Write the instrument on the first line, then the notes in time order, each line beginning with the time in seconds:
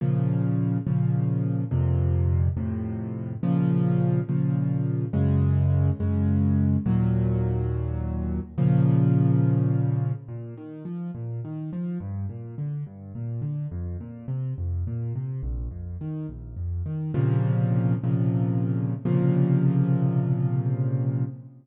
acoustic grand piano
0.01 A#2 C#3 F3
0.86 A#2 C#3 F3
1.71 F2 A#2 C3
2.56 F2 A2 C3
3.43 A#2 C#3 F3
4.28 A#2 C#3 F3
5.13 F#2 C#3 G#3
6.00 F#2 C#3 G#3
6.86 D#2 A#2 F#3
8.58 A#2 C#3 F3
10.28 A#2
10.57 D#3
10.85 F3
11.14 A#2
11.44 D#3
11.72 F3
12.00 G2
12.29 A#2
12.58 D3
12.86 G2
13.15 A#2
13.41 D3
13.71 F2
14.00 A#2
14.28 C3
14.58 F2
14.87 A#2
15.15 C3
15.43 A#1
15.71 F2
16.01 D#3
16.29 A#1
16.56 F2
16.85 D#3
17.14 A#2 C3 C#3 F3
18.03 A#2 C3 C#3 F3
19.05 A#2 C3 C#3 F3